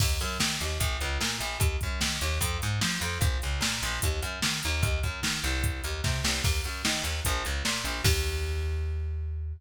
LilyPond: <<
  \new Staff \with { instrumentName = "Electric Bass (finger)" } { \clef bass \time 4/4 \key ees \major \tempo 4 = 149 ees,8 ges,8 ees8 ees,8 bes,,8 des,8 bes,8 bes,,8 | ees,8 ges,8 ees8 ees,8 f,8 aes,8 f8 f,8 | bes,,8 des,8 bes,8 bes,,8 ees,8 ges,8 ees8 ees,8 | ees,8 ges,8 ees8 c,4 ees,8 c8 c,8 |
ees,8 ges,8 ees8 ees,8 bes,,8 des,8 bes,8 bes,,8 | ees,1 | }
  \new DrumStaff \with { instrumentName = "Drums" } \drummode { \time 4/4 <cymc bd>8 hh8 sn8 hh8 <hh bd>8 hh8 sn8 hh8 | <hh bd>8 <hh bd>8 sn8 hh8 <hh bd>8 hh8 sn8 hh8 | <hh bd>8 hh8 sn8 hh8 <hh bd>8 hh8 sn8 hh8 | <hh bd>8 <hh bd>8 sn8 hh8 <hh bd>8 hh8 <bd sn>8 sn8 |
<cymc bd>8 hh8 sn8 hh8 <hh bd>8 hh8 sn8 hh8 | <cymc bd>4 r4 r4 r4 | }
>>